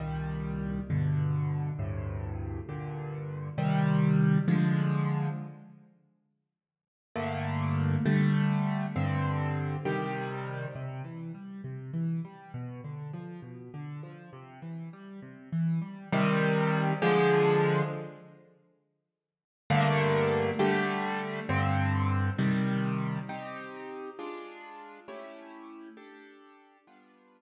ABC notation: X:1
M:6/8
L:1/8
Q:3/8=67
K:Cm
V:1 name="Acoustic Grand Piano"
[C,,B,,E,G,]3 [G,,=B,,D,]3 | [D,,G,,=A,,C,]3 [G,,B,,D,]3 | [C,E,G,]3 [D,F,A,]3 | z6 |
[G,,D,=A,B,]3 [D,G,A,]3 | [G,,D,C]3 [C,E,G,]3 | [K:C] C, E, G, C, E, G, | B,, D, F, B,, D, F, |
C, E, G, C, E, G, | [K:Cm] [C,E,G,]3 [D,F,A,]3 | z6 | [G,,D,=A,B,]3 [D,G,A,]3 |
[G,,D,C]3 [C,E,G,]3 | [CEG]3 [A,DF]3 | [=A,^C=EG]3 [DG=A]3 | [G,=B,DF]3 z3 |]